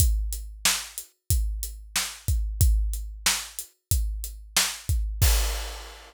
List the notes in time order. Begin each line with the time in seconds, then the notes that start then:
0.00 kick, closed hi-hat
0.33 closed hi-hat
0.65 snare
0.98 closed hi-hat
1.30 kick, closed hi-hat
1.63 closed hi-hat
1.96 snare
2.28 kick, closed hi-hat
2.61 kick, closed hi-hat
2.93 closed hi-hat
3.26 snare
3.59 closed hi-hat
3.91 kick, closed hi-hat
4.24 closed hi-hat
4.57 snare
4.89 kick, closed hi-hat
5.22 kick, crash